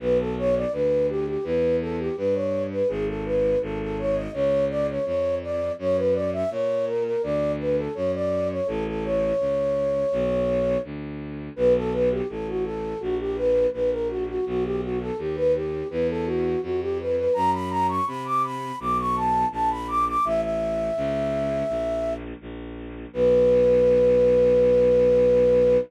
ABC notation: X:1
M:4/4
L:1/16
Q:1/4=83
K:Bm
V:1 name="Flute"
B A c d B2 G G B2 A G B c2 B | ^G A B2 A A c ^d c2 =d c c2 d2 | c B d e c2 ^A A d2 B =A c d2 c | A A c10 z4 |
B A B G A F A2 F G B2 B ^A F F | F G F A G B G2 B A F2 F G B B | ^a b a c' b d' b2 d' c' =a2 a b d' d' | e e11 z4 |
B16 |]
V:2 name="Violin" clef=bass
B,,,4 D,,4 E,,4 G,,4 | ^G,,,4 G,,,4 C,,4 ^E,,4 | F,,4 ^A,,4 D,,4 F,,4 | A,,,4 C,,4 B,,,4 D,,4 |
B,,,4 A,,,4 ^A,,,4 A,,,4 | B,,,4 ^D,,4 E,,4 =F,,4 | F,,4 =C,4 B,,,4 ^A,,,4 | A,,,4 C,,4 ^A,,,4 A,,,4 |
B,,,16 |]